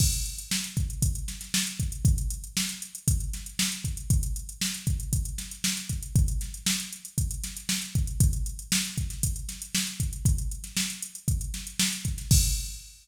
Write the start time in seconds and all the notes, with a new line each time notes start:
0.00 kick, crash
0.13 closed hi-hat
0.26 closed hi-hat
0.38 closed hi-hat
0.51 snare
0.64 closed hi-hat
0.77 kick, closed hi-hat
0.90 closed hi-hat
1.02 kick, closed hi-hat
1.15 closed hi-hat
1.28 snare, closed hi-hat
1.41 snare, closed hi-hat
1.54 snare
1.67 closed hi-hat
1.80 kick, closed hi-hat
1.92 closed hi-hat
2.05 kick, closed hi-hat
2.18 closed hi-hat
2.30 closed hi-hat
2.44 closed hi-hat
2.57 snare
2.69 snare, closed hi-hat
2.82 closed hi-hat
2.95 closed hi-hat
3.08 kick, closed hi-hat
3.20 closed hi-hat
3.33 snare, closed hi-hat
3.46 closed hi-hat
3.59 snare
3.72 closed hi-hat
3.84 kick, closed hi-hat
3.97 closed hi-hat
4.10 kick, closed hi-hat
4.23 closed hi-hat
4.36 closed hi-hat
4.49 closed hi-hat
4.61 snare
4.74 closed hi-hat
4.87 kick, closed hi-hat
5.00 closed hi-hat
5.13 kick, closed hi-hat
5.25 closed hi-hat
5.38 snare, closed hi-hat
5.51 closed hi-hat
5.64 snare
5.77 snare, closed hi-hat
5.89 kick, closed hi-hat
6.03 closed hi-hat
6.15 kick, closed hi-hat
6.28 closed hi-hat
6.41 snare, closed hi-hat
6.54 closed hi-hat
6.66 snare
6.80 closed hi-hat
6.93 closed hi-hat
7.05 closed hi-hat
7.18 kick, closed hi-hat
7.31 closed hi-hat
7.43 snare, closed hi-hat
7.57 closed hi-hat
7.69 snare
7.82 closed hi-hat
7.95 kick, closed hi-hat
8.07 closed hi-hat
8.20 kick, closed hi-hat
8.33 closed hi-hat
8.46 closed hi-hat
8.59 closed hi-hat
8.72 snare
8.85 closed hi-hat
8.98 kick, closed hi-hat
9.10 snare, closed hi-hat
9.23 kick, closed hi-hat
9.36 closed hi-hat
9.49 snare, closed hi-hat
9.62 closed hi-hat
9.75 snare
9.87 closed hi-hat
10.00 kick, closed hi-hat
10.13 closed hi-hat
10.25 kick, closed hi-hat
10.38 closed hi-hat
10.51 closed hi-hat
10.64 snare, closed hi-hat
10.77 snare
10.90 closed hi-hat
11.02 closed hi-hat
11.15 closed hi-hat
11.28 kick, closed hi-hat
11.41 closed hi-hat
11.54 snare, closed hi-hat
11.67 closed hi-hat
11.79 snare
11.93 closed hi-hat
12.05 kick, closed hi-hat
12.18 snare, closed hi-hat
12.31 kick, crash